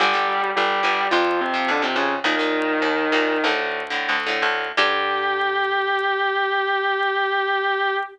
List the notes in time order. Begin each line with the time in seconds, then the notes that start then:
0.00 G1 D3 G3 G4
0.14 D3 G3
0.56 G1 G3 G4
0.83 G1 D3 G3
1.11 F2 C3 F3 F4
1.41 C3 C4
1.54 C3 F3
1.68 F2 D3 D4
1.82 C3 F3 C4
1.95 F2 C#3 C#4
2.24 D#2 A#2 D#3 D#4
2.39 A#2 D#3
2.82 D#2
3.12 D#2 A#2 D#3
3.44 D2 A2 D3
3.90 A2 D3
4.09 D2
4.27 A2 D3
4.42 D2
4.77 G2 D3 G3 G4